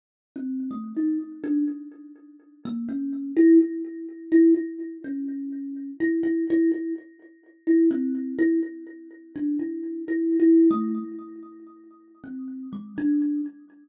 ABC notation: X:1
M:7/8
L:1/16
Q:1/4=125
K:none
V:1 name="Kalimba"
z3 C3 A,2 ^D2 z2 =D2 | z8 ^A,2 ^C4 | E2 z6 E2 E4 | ^C8 E2 E2 E2 |
E2 z6 E2 C4 | E2 z6 D2 E4 | (3E4 E4 A,4 z6 | z4 C4 ^G,2 D4 |]